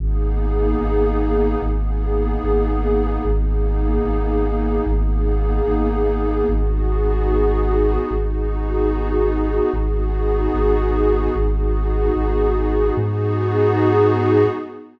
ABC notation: X:1
M:6/8
L:1/8
Q:3/8=74
K:G#m
V:1 name="Synth Bass 2" clef=bass
G,,,3 G,,,3 | G,,,3 G,,,3 | G,,,3 G,,,3 | G,,,3 G,,,3 |
G,,,6 | G,,,6 | G,,,3 G,,,3 | G,,,3 G,,,3 |
G,,6 |]
V:2 name="Pad 5 (bowed)"
[A,B,DG]6 | [A,B,DG]6 | [A,B,DG]6 | [A,B,DG]6 |
[B,DFG]6 | [B,DFG]6 | [B,DFG]6 | [B,DFG]6 |
[B,DFG]6 |]